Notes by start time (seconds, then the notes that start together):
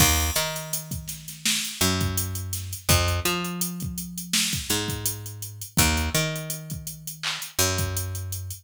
0.00 D#2, kick, crash
0.20 closed hi-hat
0.36 D#3, closed hi-hat
0.56 closed hi-hat
0.73 closed hi-hat
0.91 kick, closed hi-hat
1.08 snare, closed hi-hat
1.28 snare, closed hi-hat
1.45 snare
1.64 closed hi-hat
1.81 F#2, closed hi-hat
2.01 kick, closed hi-hat
2.17 closed hi-hat
2.35 closed hi-hat
2.53 snare, closed hi-hat
2.73 closed hi-hat
2.89 F2, kick, closed hi-hat
3.08 closed hi-hat
3.25 F3, closed hi-hat
3.44 closed hi-hat
3.61 closed hi-hat
3.80 kick, closed hi-hat
3.98 closed hi-hat
4.18 closed hi-hat
4.33 snare
4.53 kick, closed hi-hat
4.70 G#2, closed hi-hat
4.88 kick, closed hi-hat
5.06 closed hi-hat
5.26 closed hi-hat
5.42 closed hi-hat
5.61 closed hi-hat
5.77 D#2, kick, closed hi-hat
5.97 closed hi-hat
6.14 D#3, closed hi-hat
6.36 closed hi-hat
6.50 closed hi-hat
6.70 kick, closed hi-hat
6.87 closed hi-hat
7.07 closed hi-hat
7.23 clap
7.42 closed hi-hat
7.59 F#2, closed hi-hat
7.78 kick, closed hi-hat
7.97 closed hi-hat
8.15 closed hi-hat
8.32 closed hi-hat
8.50 closed hi-hat